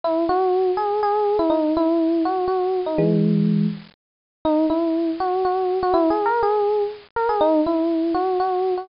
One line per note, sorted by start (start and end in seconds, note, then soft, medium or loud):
0.04 0.24 E4 loud
0.29 0.71 F#4 loud
0.77 1.00 G#4 medium
1.03 1.37 G#4 loud
1.39 1.51 E4 loud
1.50 1.73 D#4 loud
1.77 2.23 E4 loud
2.25 2.45 F#4 medium
2.47 2.80 F#4 medium
2.86 2.98 D#4 medium
2.98 3.66 E3 medium
2.98 3.66 G#3 loud
4.45 4.65 D#4 loud
4.70 5.10 E4 medium
5.20 5.43 F#4 medium
5.45 5.78 F#4 medium
5.83 5.94 F#4 loud
5.93 6.09 E4 loud
6.10 6.26 G#4 medium
6.26 6.41 A#4 loud
6.43 6.83 G#4 loud
7.16 7.28 A#4 medium
7.29 7.40 G#4 medium
7.41 7.60 D#4 loud
7.66 8.13 E4 medium
8.14 8.38 F#4 medium
8.40 8.74 F#4 medium
8.77 8.88 F#4 medium